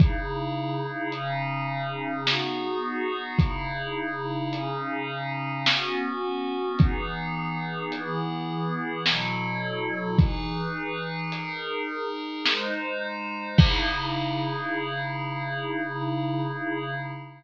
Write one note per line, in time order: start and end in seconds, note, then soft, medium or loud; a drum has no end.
0.00 1.12 C#3 medium
0.00 1.12 D#4 medium
0.00 1.12 E4 medium
0.00 1.12 G#4 medium
0.00 kick loud
0.00 closed hi-hat medium
1.12 2.26 C#3 medium
1.12 2.26 C#4 medium
1.12 2.26 D#4 medium
1.12 2.26 G#4 medium
1.12 closed hi-hat medium
2.27 3.39 B3 medium
2.27 3.39 D#4 medium
2.27 3.39 F#4 medium
2.27 3.39 G#4 medium
2.27 snare medium
3.39 4.52 C#3 medium
3.39 4.52 D#4 medium
3.39 4.52 E4 medium
3.39 4.52 G#4 medium
3.39 kick medium
3.39 closed hi-hat medium
4.53 5.65 C#3 medium
4.53 5.65 C#4 medium
4.53 5.65 D#4 medium
4.53 5.65 G#4 medium
4.53 closed hi-hat medium
5.66 6.78 B3 medium
5.66 6.78 C#4 medium
5.66 6.78 F#4 medium
5.66 snare loud
6.79 7.92 E3 medium
6.79 7.92 B3 medium
6.79 7.92 D#4 medium
6.79 7.92 G#4 medium
6.79 kick medium
6.79 closed hi-hat medium
7.92 9.04 E3 medium
7.92 9.04 B3 medium
7.92 9.04 E4 medium
7.92 9.04 G#4 medium
7.92 closed hi-hat medium
9.06 10.18 B2 medium
9.06 10.18 F#3 medium
9.06 10.18 E4 medium
9.06 10.18 A4 medium
9.06 snare loud
10.19 11.31 E3 medium
10.19 11.31 D#4 medium
10.19 11.31 G#4 medium
10.19 11.31 B4 medium
10.19 kick medium
10.19 closed hi-hat medium
11.32 12.44 D#4 medium
11.32 12.44 G#4 medium
11.32 12.44 A#4 medium
11.32 closed hi-hat loud
12.45 13.57 G#3 medium
12.45 13.57 D#4 medium
12.45 13.57 C5 medium
12.45 snare medium
13.58 16.94 C#3 loud
13.58 16.94 D#4 medium
13.58 16.94 E4 loud
13.58 16.94 G#4 loud
13.58 kick loud
13.58 crash loud